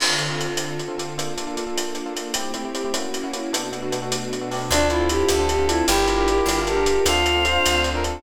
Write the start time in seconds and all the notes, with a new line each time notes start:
0.00 D3 C4 F4 A4, crash
0.19 D3 C4 F4 A4, closed hi-hat
0.29 D3 C4 F4 A4
0.39 D3 C4 F4 A4, closed hi-hat
0.49 D3 C4 F4 A4
0.57 closed hi-hat
0.79 closed hi-hat
0.88 D3 C4 F4 A4
0.98 D3 C4 F4 A4, closed hi-hat
1.17 A#3 D4 F4 A4, closed hi-hat
1.37 A#3 D4 F4 A4, closed hi-hat
1.47 A#3 D4 F4 A4
1.57 A#3 D4 F4 A4, closed hi-hat
1.67 A#3 D4 F4 A4
1.78 closed hi-hat
1.95 closed hi-hat
2.06 A#3 D4 F4 A4
2.16 A#3 D4 F4 A4, closed hi-hat
2.34 A3 C4 E4 G4, closed hi-hat
2.54 A3 C4 E4 G4, closed hi-hat
2.65 A3 C4 E4 G4
2.74 A3 C4 E4 G4, closed hi-hat
2.85 A3 C4 E4 G4
2.94 A#3 C#4 E4 F#4, closed hi-hat
3.14 closed hi-hat
3.24 A#3 C#4 E4 F#4
3.33 A#3 C#4 E4 F#4, closed hi-hat
3.53 B2 A3 B3 D4 F#4 A4, closed hi-hat
3.72 B3 D4 F#4 A4, closed hi-hat
3.82 B3 D4 F#4 A4
3.92 B3 D4 F#4 A4, closed hi-hat
4.02 B3 D4 F#4 A4
4.12 closed hi-hat
4.33 closed hi-hat
4.41 B3 D4 F#4 A4
4.51 B3 D4 F#4 A4, open hi-hat
4.70 D2 C4 D4 F4 A4, closed hi-hat
4.90 C4 D4 E4 F4 A4, closed hi-hat
5.00 C4 D4 F4 A4
5.09 C4 D4 F4 G4 A4, closed hi-hat
5.29 D2 A4, closed hi-hat
5.39 C4 D4 F4 A4
5.49 G4, closed hi-hat
5.59 C4 D4 F4 A4
5.69 C4 D4 E4 F4 A4, closed hi-hat
5.88 G1 D4 E4 F4 G4 A#4, closed hi-hat
6.08 D4 F4 G4 A#4, closed hi-hat
6.18 D4 F4 G4 A#4
6.27 D4 F4 G4 A#4, closed hi-hat
6.46 G1, closed hi-hat
6.57 D4 F4 G4 A#4
6.66 G4 A4, closed hi-hat
6.76 D4 F4 G4 A#4
6.86 D4 F4 G4 A#4, closed hi-hat
7.06 D2 C4 D4 F4 A4 F5, closed hi-hat
7.25 C4 D4 F4 A4, closed hi-hat
7.35 C4 D4 F4 A4
7.45 C4 D4 F4 A4 C5, closed hi-hat
7.66 D2, closed hi-hat
7.74 C4 D4 F4 A4
7.84 closed hi-hat
7.94 C4 D4 F4 A4 A#4
8.04 C4 D4 F4 A4, closed hi-hat